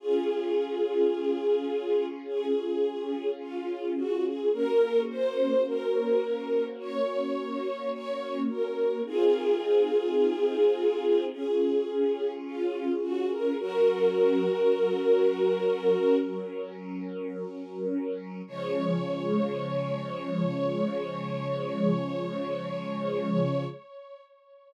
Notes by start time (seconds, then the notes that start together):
0.00 C#4 F4 G#4
2.26 G#4
3.40 F4
3.96 F#4
4.25 G#4
4.53 A#3 C#4 F#4 A#4
5.09 C5
5.66 A#4
6.79 C#5
7.92 C#5
8.49 A#4
9.06 C4 D#4 F4 G#4
11.32 C#4 F4 G#4
12.45 F4
13.02 F#4
13.30 A#4
13.58 F#3 C#4 F#4 A#4
18.47 C#3 F3 G#3 C#5